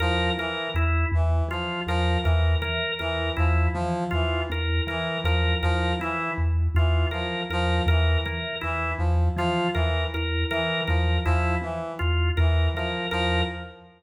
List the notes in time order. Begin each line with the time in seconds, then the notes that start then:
0.00 E2 F3 A#4
0.38 E3 A#4
0.75 E2 E4
1.12 E2 E3
1.49 E3 F3 F4
1.87 E2 F3 A#4
2.23 E2 E3 A#4
2.62 E3 A#4
2.99 E2 E3 A#4
3.37 E2 F3 E4
3.74 E3 F3
4.11 E2 E3 F4
4.50 E2 A#4
4.87 E3 A#4
5.24 E2 F3 A#4
5.63 E2 F3 A#4
6.00 E3 E4
6.38 E2
6.75 E2 E3 F4
7.11 E3 F3 A#4
7.50 E2 F3 A#4
7.86 E2 E3 A#4
8.25 E3 A#4
8.61 E2 E3 E4
8.98 E2 F3
9.37 E3 F3 F4
9.73 E2 E3 A#4
10.14 E2 A#4
10.51 E3 A#4
10.88 E2 F3 A#4
11.25 E2 F3 E4
11.62 E3
11.99 E2 F4
12.37 E2 E3 A#4
12.74 E3 F3 A#4
13.11 E2 F3 A#4